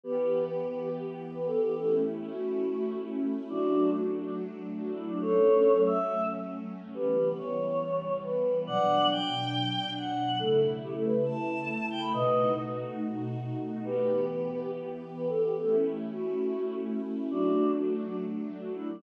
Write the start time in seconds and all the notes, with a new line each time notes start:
0.04 E3 B3 G4 B4
0.47 B4
0.68 B4
0.79 G4
1.33 B4
1.47 A4
1.62 G4
1.76 A3 C#4 E4 A4
2.30 F#4
3.49 F#3 A3 D4 F#4
3.92 F#4
4.13 F#4
4.24 D4
4.78 F#4
4.92 E4
5.07 D4
5.21 F#3 A3 C#4 A4 C#5
5.86 E5
6.94 E3 G3 B3 G4 B4
7.37 C#5
8.23 B4
8.66 B2 F#3 D4 D5 F#5
9.11 G5
9.97 F#5
10.39 C#3 A3 E4 A4
10.83 G4
10.93 A4
11.04 B4
11.26 A5
11.90 G5
12.01 B5
12.13 B2 A3 D#4 F#4 B4 D#5
13.84 E3 B3 G4 B4
14.28 B4
14.49 B4
14.61 G4
15.15 B4
15.29 A4
15.44 G4
15.58 A3 C#4 E4 A4
16.11 F#4
17.30 F#3 A3 D4 F#4
17.74 F#4
17.95 F#4
18.06 D4
18.60 F#4
18.74 E4
18.89 D4